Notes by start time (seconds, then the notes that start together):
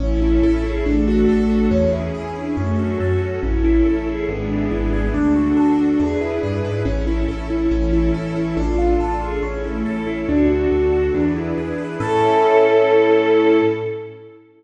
0.00 A1 C#4 E4 A4
0.22 E4
0.43 A1 A4
0.64 E4 G#4
0.86 A1 A3 D4 F#4 A4
1.08 F#4
1.29 A1 A4
1.50 F#4
1.71 E2 C#4 E4 G#4
1.93 E4
2.14 E2 G#4
2.36 D4 E4
2.57 F#2 A3 C#4 F#4 A4
2.78 F#3 F#4
3.00 F#2 F#4 A4
3.22 F#4
3.43 A1 C#4 E4 A4
3.64 E4
3.86 A1 A4
4.07 E4 G#4
4.28 G#1 G#3 B3 D4 E4 G#4
4.50 D4
4.71 G#1 E4
4.93 G#4
5.14 D2 D4 F#4 A4
5.36 F#4
5.57 D2 A4
5.79 F#4
5.99 E2 D4 E4 G#4 B4
6.21 E4
6.43 G2 G#4
6.64 G#2 B4
6.85 A1 C#4 E4 A4
7.07 E4
7.28 A1 A4
7.50 E4
7.71 A1 E3 C#4 E4 A4
7.93 E4
8.14 A1 A4
8.36 E4
8.57 A1 D4 F4 A4
8.78 F4
9.00 A1 A4
9.21 F4 G#4
9.43 A1 C#4 E4 A4
9.64 A3 E4
9.86 A1 A4
10.07 E4
10.28 D2 D4 F#4 A4
10.50 F#4
10.71 D2 A4
10.92 F#4
11.14 E2 D4 E4 G#4 B4
11.36 E4
11.57 E2 G#4
11.78 B4
12.00 A2 C#4 E4 A4